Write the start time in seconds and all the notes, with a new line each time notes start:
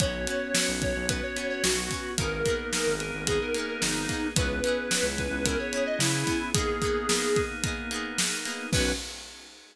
0.00 B1 B3 C#4 F#4 C#5, kick, closed hi-hat
0.27 B3 C#4 F#4, closed hi-hat
0.54 B3 C#4 F#4, snare
0.68 B1
0.82 B3 C#5, kick, closed hi-hat
0.96 B1
1.09 B3 C#4 F#4 B4, kick, closed hi-hat
1.23 C#5
1.36 B3 C#4 F#4, closed hi-hat
1.50 C#5
1.63 B1 B3 F#4, snare
1.90 B3 C#4, kick, closed hi-hat
1.94 F#4
2.18 G#1 A#3 B3 D#4 G#4 A#4, kick, closed hi-hat
2.23 G#4
2.44 A#3 B3, kick, closed hi-hat
2.48 D#4 G#4
2.72 A#3 B3 D#4, snare
2.77 G#4
2.86 G#1
3.00 G#4 A#4, closed hi-hat
3.14 G#1
3.26 A#3 B3 D#4 G#4, kick, closed hi-hat
3.32 G#4
3.41 A#4
3.54 A#3 B3 D#4, closed hi-hat
3.59 G#4
3.68 A#4
3.82 G#1 D#4, snare
4.09 A#3 B3 D#4 G#4, kick, closed hi-hat
4.14 G#4
4.36 C#2 B3 C#4 E4 G#4 B4, kick, closed hi-hat
4.41 G#4
4.64 B3 C#4 E4, closed hi-hat
4.68 G#4
4.91 B3 C#4 E4, snare
4.96 G#4
5.03 C#2
5.18 G#4 B4, kick, closed hi-hat
5.31 C#2
5.45 B3 C#4 E4 A#4, kick, closed hi-hat
5.50 G#4
5.59 C#5
5.72 B3 C#4 E4, closed hi-hat
5.77 G#4
5.86 D#5
5.99 C#3 E4, snare
6.26 B3 C#4 E4 G#4, kick, closed hi-hat
6.32 G#4
6.54 A#3 B3 D#4 G#4, kick, closed hi-hat
6.59 G#4
6.82 A#3 B3 D#4, kick, closed hi-hat
6.87 G#4
7.09 A#3 B3 D#4, snare
7.14 G#4
7.36 G#4, kick, closed hi-hat
7.63 A#3 B3 D#4, kick, closed hi-hat
7.68 G#4
7.91 A#3 B3 D#4, closed hi-hat
7.96 G#4
8.18 D#4, snare
8.45 A#3 B3 D#4 G#4, closed hi-hat
8.50 G#4
8.72 B1 B3 C#4 F#4 B4, kick, crash